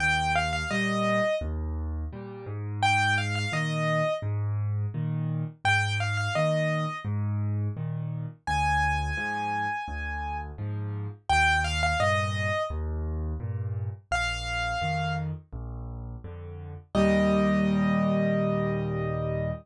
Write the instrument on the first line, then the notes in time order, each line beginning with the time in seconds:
acoustic grand piano
0.00 D#2 G5
0.35 F5
0.53 F5
0.71 A#2 G3 D#5
1.41 D#2
2.12 A#2 G3
2.46 G#2
2.82 G5
3.18 F5
3.35 F5
3.52 A#2 D#3 D#5
4.22 G#2
4.94 A#2 D#3
5.65 G#2 G5
6.00 F5
6.17 F5
6.35 A#2 D#3 D#5
7.05 G#2
7.77 A#2 D#3
8.47 D2 G#5
9.17 G#2 F3
9.88 D2
10.58 G#2 F3
11.29 D#2 G5
11.64 F5
11.83 F5
12.00 G2 A#2 D#5
12.70 D#2
13.40 G2 A#2
14.11 A#1 F5
14.81 F2 D#3
15.52 A#1
16.24 F2 D3
16.95 D#2 A#2 G3 D#5